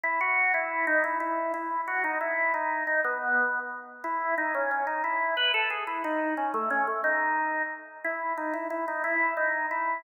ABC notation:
X:1
M:6/8
L:1/8
Q:3/8=120
K:E
V:1 name="Drawbar Organ"
E F2 E2 D | E E2 E2 F | D E2 D2 D | B,4 z2 |
E2 D C C D | E2 B A G E | D2 C A, C A, | D4 z2 |
E2 D E E D | E2 D2 E2 |]